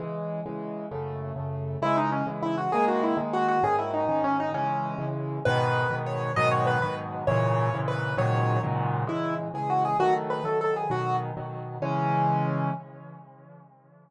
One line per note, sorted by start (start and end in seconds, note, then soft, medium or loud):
0.00 0.41 C#3 medium
0.00 0.41 E3 medium
0.00 0.41 G#3 medium
0.46 0.87 C#3 medium
0.46 0.87 E3 medium
0.46 0.87 G#3 medium
0.91 1.32 F#2 medium
0.91 1.32 C#3 medium
0.91 1.32 A3 medium
1.36 1.77 F#2 medium
1.36 1.77 C#3 medium
1.36 1.77 A3 medium
1.82 2.23 C#3 medium
1.82 2.23 E3 medium
1.82 2.23 G#3 medium
1.82 1.96 E4 loud
1.97 2.10 D#4 medium
2.12 2.26 C#4 medium
2.27 2.68 C#3 medium
2.27 2.68 E3 medium
2.27 2.68 G#3 medium
2.42 2.56 E4 medium
2.58 2.71 F#4 medium
2.72 3.14 D#3 medium
2.72 3.14 G#3 medium
2.72 3.14 A#3 medium
2.72 2.85 G#4 medium
2.88 3.02 F#4 medium
3.03 3.17 E4 medium
3.17 3.58 D#3 medium
3.17 3.58 G#3 medium
3.17 3.58 A#3 medium
3.33 3.47 F#4 medium
3.48 3.63 F#4 medium
3.63 4.04 G#2 medium
3.63 4.04 D#3 medium
3.63 4.04 C#4 medium
3.63 3.76 G#4 medium
3.79 3.91 E4 medium
3.93 4.22 D#4 medium
4.09 4.50 G#2 medium
4.09 4.50 D#3 medium
4.09 4.50 C#4 medium
4.24 4.37 C#4 medium
4.40 4.52 D#4 medium
4.54 4.95 C#3 medium
4.54 4.95 E3 medium
4.54 4.95 G#3 medium
4.54 5.05 C#4 medium
4.98 5.39 C#3 medium
4.98 5.39 E3 medium
4.98 5.39 G#3 medium
5.45 5.87 G#2 loud
5.45 5.87 B2 loud
5.45 5.87 D#3 loud
5.45 5.95 B4 loud
5.90 6.31 G#2 medium
5.90 6.31 B2 medium
5.90 6.31 D#3 medium
6.06 6.32 C#5 medium
6.36 6.78 G#2 loud
6.36 6.78 B2 loud
6.36 6.78 D#3 loud
6.36 6.78 F#3 medium
6.36 6.49 D#5 loud
6.51 6.66 C#5 medium
6.67 6.82 B4 medium
6.82 7.24 G#2 medium
6.82 7.24 B2 medium
6.82 7.24 D#3 medium
6.82 7.24 F#3 medium
6.82 6.95 B4 medium
7.27 7.69 G#2 medium
7.27 7.69 A#2 loud
7.27 7.69 C#3 loud
7.27 7.69 E3 loud
7.27 7.77 C#5 medium
7.73 8.14 G#2 medium
7.73 8.14 A#2 medium
7.73 8.14 C#3 medium
7.73 8.14 E3 medium
7.88 8.16 B4 medium
8.17 8.58 G#2 loud
8.17 8.58 A#2 loud
8.17 8.58 C#3 medium
8.17 8.58 D#3 loud
8.17 8.58 F#3 loud
8.17 8.61 C#5 medium
8.63 9.04 G#2 medium
8.63 9.04 A#2 medium
8.63 9.04 C#3 medium
8.63 9.04 D#3 medium
8.63 9.04 F#3 medium
9.07 9.48 C#3 medium
9.07 9.48 E3 medium
9.07 9.48 G#3 medium
9.07 9.34 E4 medium
9.54 9.95 C#3 medium
9.54 9.95 E3 medium
9.54 9.95 G#3 medium
9.54 9.69 G#4 medium
9.70 9.83 F#4 medium
9.85 9.97 G#4 medium
9.99 10.40 D#3 medium
9.99 10.40 F#3 medium
9.99 10.40 A3 medium
9.99 10.14 F#4 loud
10.30 10.44 B4 medium
10.44 10.85 D#3 medium
10.44 10.85 F#3 medium
10.44 10.85 A3 medium
10.44 10.58 A4 medium
10.61 10.74 A4 medium
10.76 10.90 G#4 medium
10.90 11.31 B2 medium
10.90 11.31 D#3 medium
10.90 11.31 F#3 medium
10.90 11.16 F#4 medium
11.37 11.78 B2 medium
11.37 11.78 D#3 medium
11.37 11.78 F#3 medium
11.82 12.70 C#3 medium
11.82 12.70 E3 medium
11.82 12.70 G#3 medium
11.82 12.70 C#4 loud